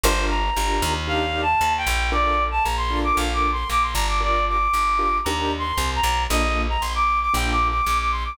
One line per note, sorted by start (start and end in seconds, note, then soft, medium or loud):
0.03 0.51 G1 loud
0.03 0.42 D4 medium
0.03 0.42 F4 medium
0.03 0.42 G4 medium
0.03 0.42 A#4 loud
0.03 0.25 C5 loud
0.30 0.93 A#5 medium
0.57 0.81 G1 medium
0.57 0.93 D4 medium
0.57 0.93 F4 medium
0.57 0.93 G4 medium
0.57 0.93 A#4 medium
0.82 1.55 D#2 loud
1.07 1.44 D4 medium
1.07 1.44 D#4 medium
1.07 1.44 G4 medium
1.07 1.44 A#4 medium
1.07 1.41 F5 medium
1.42 1.73 A5 medium
1.61 1.86 D#2 medium
1.77 2.10 G5 loud
1.87 2.60 A#1 loud
2.12 2.49 D4 medium
2.12 2.49 F4 medium
2.12 2.49 A4 medium
2.12 2.49 A#4 medium
2.12 2.44 D5 loud
2.51 2.63 A5 medium
2.64 3.12 A#1 medium
2.64 2.76 A#5 medium
2.77 2.99 C6 loud
2.91 3.53 D4 medium
2.91 3.53 F4 medium
2.91 3.53 A4 medium
2.91 3.53 A#4 medium
3.04 3.16 D6 medium
3.16 3.64 A#1 medium
3.16 3.33 F5 medium
3.34 3.50 D6 medium
3.52 3.69 C6 loud
3.70 3.94 A#1 medium
3.70 3.83 D6 loud
3.82 3.94 C6 medium
3.94 4.68 G1 loud
3.94 4.06 A#5 medium
4.08 4.21 D6 medium
4.21 4.57 D4 medium
4.21 4.57 F4 medium
4.21 4.57 G4 medium
4.21 4.57 A#4 medium
4.21 4.45 D5 loud
4.48 5.18 D6 medium
4.73 5.20 G1 medium
4.99 5.17 D4 medium
4.99 5.17 F4 medium
4.99 5.17 G4 medium
4.99 5.17 A#4 medium
5.24 5.73 D#2 loud
5.24 5.63 D4 medium
5.24 5.63 D#4 medium
5.24 5.63 G4 medium
5.24 5.63 A#4 medium
5.24 5.52 A#5 medium
5.59 5.91 C6 loud
5.77 6.01 C2 medium
5.96 6.23 A#5 loud
6.03 6.27 B1 medium
6.30 6.77 A#1 loud
6.30 6.67 A#3 medium
6.30 6.67 D4 medium
6.30 6.67 F4 medium
6.30 6.67 A4 medium
6.30 6.61 D#5 loud
6.69 6.82 A#5 loud
6.81 7.29 A#1 medium
6.81 6.93 C6 medium
6.95 7.19 D6 medium
7.21 7.33 D6 loud
7.34 7.81 A#1 loud
7.34 7.70 A#3 medium
7.34 7.70 D4 medium
7.34 7.70 F4 medium
7.34 7.70 A4 medium
7.34 7.50 G5 medium
7.51 7.67 D6 loud
7.69 7.85 D6 medium
7.86 8.33 A#1 medium
7.86 7.98 D6 medium
7.98 8.11 D6 medium
8.11 8.24 C6 medium
8.25 8.37 D6 medium